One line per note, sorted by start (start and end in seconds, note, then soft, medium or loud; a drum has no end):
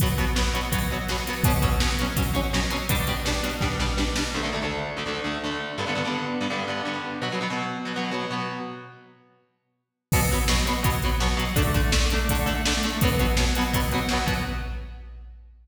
0.00 0.08 B2 medium
0.00 0.08 F#3 medium
0.00 0.08 B3 loud
0.00 kick medium
0.00 closed hi-hat medium
0.18 0.25 B2 medium
0.18 0.25 F#3 medium
0.18 0.25 B3 medium
0.18 closed hi-hat medium
0.36 0.43 B2 medium
0.36 0.43 F#3 medium
0.36 0.43 B3 medium
0.36 snare loud
0.53 0.60 B2 medium
0.53 0.60 F#3 medium
0.53 0.60 B3 medium
0.53 closed hi-hat medium
0.72 0.79 B2 medium
0.72 0.79 F#3 medium
0.72 0.79 B3 medium
0.72 kick medium
0.72 closed hi-hat medium
0.91 0.98 B2 medium
0.91 0.98 F#3 medium
0.91 0.98 B3 medium
1.08 1.16 B2 medium
1.08 1.16 F#3 medium
1.08 1.16 B3 medium
1.08 snare medium
1.08 closed hi-hat medium
1.27 1.34 B2 medium
1.27 1.34 F#3 medium
1.27 1.34 B3 medium
1.27 closed hi-hat medium
1.44 1.52 B2 loud
1.44 1.52 F#3 medium
1.44 1.52 C#4 medium
1.44 kick loud
1.44 closed hi-hat loud
1.62 1.69 B2 medium
1.62 1.69 F#3 medium
1.62 1.69 C#4 medium
1.62 kick medium
1.62 closed hi-hat medium
1.80 1.89 B2 medium
1.80 1.89 F#3 medium
1.80 1.89 C#4 medium
1.80 snare loud
1.99 2.07 B2 medium
1.99 2.07 F#3 medium
1.99 2.07 C#4 medium
1.99 closed hi-hat medium
2.16 2.23 B2 medium
2.16 2.23 F#3 medium
2.16 2.23 C#4 medium
2.16 kick medium
2.16 closed hi-hat medium
2.34 2.41 B2 medium
2.34 2.41 F#3 medium
2.34 2.41 C#4 medium
2.34 closed hi-hat medium
2.53 2.60 B2 medium
2.53 2.60 F#3 medium
2.53 2.60 C#4 medium
2.53 snare medium
2.70 2.77 B2 medium
2.70 2.77 F#3 medium
2.70 2.77 C#4 medium
2.70 closed hi-hat medium
2.89 2.96 B2 medium
2.89 2.96 G3 loud
2.89 2.96 D4 loud
2.89 kick medium
2.89 closed hi-hat loud
3.07 3.15 B2 medium
3.07 3.15 G3 medium
3.07 3.15 D4 medium
3.07 closed hi-hat medium
3.25 3.32 B2 medium
3.25 3.32 G3 medium
3.25 3.32 D4 medium
3.25 snare medium
3.43 3.50 B2 medium
3.43 3.50 G3 medium
3.43 3.50 D4 medium
3.43 closed hi-hat medium
3.61 3.68 B2 medium
3.61 3.68 G3 medium
3.61 3.68 D4 medium
3.61 kick medium
3.61 snare medium
3.79 3.87 B2 medium
3.79 3.87 G3 medium
3.79 3.87 D4 medium
3.79 snare medium
3.97 4.04 B2 medium
3.97 4.04 G3 medium
3.97 4.04 D4 medium
3.97 snare medium
4.16 4.23 B2 medium
4.16 4.23 G3 medium
4.16 4.23 D4 medium
4.16 snare medium
4.34 4.41 D2 medium
4.34 4.41 D3 medium
4.34 4.41 A3 medium
4.43 4.50 D2 medium
4.43 4.50 D3 medium
4.43 4.50 A3 medium
4.52 4.60 D2 medium
4.52 4.60 D3 medium
4.52 4.60 A3 medium
4.62 4.91 D2 medium
4.62 4.91 D3 medium
4.62 4.91 A3 medium
4.97 5.04 D2 medium
4.97 5.04 D3 medium
4.97 5.04 A3 medium
5.06 5.20 D2 medium
5.06 5.20 D3 medium
5.06 5.20 A3 medium
5.24 5.38 D2 medium
5.24 5.38 D3 medium
5.24 5.38 A3 medium
5.44 5.73 D2 medium
5.44 5.73 D3 medium
5.44 5.73 A3 medium
5.78 5.85 G2 medium
5.78 5.85 D3 medium
5.78 5.85 B3 medium
5.87 5.94 G2 medium
5.87 5.94 D3 medium
5.87 5.94 B3 medium
5.95 6.02 G2 medium
5.95 6.02 D3 medium
5.95 6.02 B3 medium
6.05 6.34 G2 medium
6.05 6.34 D3 medium
6.05 6.34 B3 medium
6.41 6.48 G2 medium
6.41 6.48 D3 medium
6.41 6.48 B3 medium
6.50 6.65 G2 medium
6.50 6.65 D3 medium
6.50 6.65 B3 medium
6.68 6.82 G2 medium
6.68 6.82 D3 medium
6.68 6.82 B3 medium
6.85 7.14 G2 medium
6.85 7.14 D3 medium
6.85 7.14 B3 medium
7.22 7.29 B2 medium
7.22 7.29 F#3 medium
7.22 7.29 B3 medium
7.32 7.39 B2 medium
7.32 7.39 F#3 medium
7.32 7.39 B3 medium
7.41 7.48 B2 medium
7.41 7.48 F#3 medium
7.41 7.48 B3 medium
7.50 7.79 B2 medium
7.50 7.79 F#3 medium
7.50 7.79 B3 medium
7.85 7.92 B2 medium
7.85 7.92 F#3 medium
7.85 7.92 B3 medium
7.96 8.10 B2 medium
7.96 8.10 F#3 medium
7.96 8.10 B3 medium
8.11 8.26 B2 medium
8.11 8.26 F#3 medium
8.11 8.26 B3 medium
8.30 8.59 B2 medium
8.30 8.59 F#3 medium
8.30 8.59 B3 medium
10.12 10.20 B2 loud
10.12 10.20 F#3 medium
10.12 10.20 B3 loud
10.12 kick medium
10.12 crash medium
10.31 10.39 B2 medium
10.31 10.39 F#3 medium
10.31 10.39 B3 medium
10.48 10.56 B2 medium
10.48 10.56 F#3 medium
10.48 10.56 B3 medium
10.48 snare loud
10.66 10.73 B2 medium
10.66 10.73 F#3 medium
10.66 10.73 B3 medium
10.66 closed hi-hat medium
10.83 10.90 B2 medium
10.83 10.90 F#3 loud
10.83 10.90 B3 loud
10.83 kick medium
10.83 closed hi-hat medium
11.02 11.10 B2 medium
11.02 11.10 F#3 medium
11.02 11.10 B3 medium
11.02 closed hi-hat medium
11.20 11.28 B2 medium
11.20 11.28 F#3 loud
11.20 11.28 B3 medium
11.20 snare medium
11.37 11.44 B2 loud
11.37 11.44 F#3 medium
11.37 11.44 B3 medium
11.37 closed hi-hat medium
11.56 11.63 D3 loud
11.56 11.63 A3 loud
11.56 11.63 D4 loud
11.56 kick medium
11.56 closed hi-hat medium
11.74 11.81 D3 medium
11.74 11.81 A3 loud
11.74 11.81 D4 medium
11.74 kick medium
11.74 closed hi-hat medium
11.92 11.99 D3 medium
11.92 11.99 A3 loud
11.92 11.99 D4 medium
11.92 snare loud
12.10 12.19 D3 medium
12.10 12.19 A3 loud
12.10 closed hi-hat medium
12.15 12.19 D4 medium
12.29 12.38 D3 medium
12.29 12.38 A3 medium
12.29 12.38 D4 medium
12.29 kick medium
12.29 closed hi-hat medium
12.46 12.53 D3 medium
12.46 12.53 A3 medium
12.46 12.53 D4 medium
12.46 closed hi-hat medium
12.66 12.73 D3 medium
12.66 12.73 A3 medium
12.66 12.73 D4 medium
12.66 snare loud
12.83 12.91 D3 medium
12.83 12.91 A3 loud
12.83 12.91 D4 medium
12.83 closed hi-hat medium
13.01 13.09 B2 loud
13.01 13.09 F#3 loud
13.01 13.09 B3 loud
13.01 kick medium
13.01 closed hi-hat medium
13.19 13.26 B2 medium
13.19 13.26 F#3 medium
13.19 13.26 B3 medium
13.19 closed hi-hat medium
13.37 13.45 B2 medium
13.37 13.45 F#3 medium
13.37 13.45 B3 medium
13.37 snare loud
13.55 13.64 B2 medium
13.55 13.64 F#3 medium
13.55 13.64 B3 medium
13.55 closed hi-hat medium
13.73 13.80 B2 medium
13.73 13.80 F#3 medium
13.73 13.80 B3 medium
13.73 kick medium
13.73 closed hi-hat medium
13.91 14.00 B2 medium
13.91 14.00 F#3 loud
13.91 14.00 B3 medium
13.91 closed hi-hat medium
14.09 14.18 B2 medium
14.09 14.18 F#3 medium
14.09 snare medium
14.13 14.18 B3 medium
14.26 14.33 B2 medium
14.26 14.33 F#3 medium
14.26 14.33 B3 medium
14.26 kick medium
14.26 closed hi-hat medium